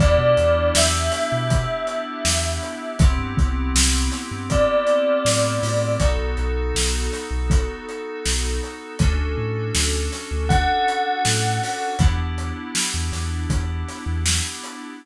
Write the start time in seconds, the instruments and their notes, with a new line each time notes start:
0.00 synth bass 2 E2, electric piano 2 B3 D4 E4 G4, tubular bells D5, kick, closed hi-hat
0.18 synth bass 2 B2
0.37 synth bass 2 E2, closed hi-hat
0.75 synth bass 2 E2, tubular bells E5, snare
1.12 snare, closed hi-hat
1.32 synth bass 2 B2
1.50 kick, closed hi-hat
1.87 closed hi-hat
2.25 synth bass 2 E2, snare
2.63 closed hi-hat
2.99 synth bass 2 C2, electric piano 2 B3 C4 E4 G4, kick, closed hi-hat
3.18 synth bass 2 G2
3.37 synth bass 2 C2, kick, closed hi-hat
3.75 synth bass 2 C2, snare
4.12 snare, closed hi-hat
4.31 synth bass 2 G2
4.50 tubular bells D5, kick, closed hi-hat
4.87 closed hi-hat
5.25 synth bass 2 A2, snare
5.63 synth bass 2 A2, open hi-hat
6.00 synth bass 2 B1, electric piano 2 B3 D#4 F#4 A4, kick, closed hi-hat
6.18 synth bass 2 B1
6.37 synth bass 2 B1, closed hi-hat
6.75 synth bass 2 B1, snare
7.12 snare, closed hi-hat
7.31 synth bass 2 B1
7.50 kick, closed hi-hat
7.89 closed hi-hat
8.25 synth bass 2 B1, snare
8.63 closed hi-hat
8.99 synth bass 2 D2, electric piano 2 C#4 D4 F#4 A4, kick, closed hi-hat
9.19 synth bass 2 D2
9.38 synth bass 2 A2
9.75 synth bass 2 D2, snare, closed hi-hat
10.12 snare, closed hi-hat
10.31 synth bass 2 D2
10.49 tubular bells F#5, kick, closed hi-hat
10.88 closed hi-hat
11.25 synth bass 2 A2, snare
11.63 open hi-hat
11.99 synth bass 2 E2, electric piano 2 B3 D4 E4 G4, kick, closed hi-hat
12.18 synth bass 2 E2
12.38 closed hi-hat
12.75 snare
12.94 synth bass 2 E2
13.12 synth bass 2 E2, snare, closed hi-hat
13.50 synth bass 2 E2, kick, closed hi-hat
13.88 snare, closed hi-hat
14.06 synth bass 2 E2
14.26 snare
14.64 closed hi-hat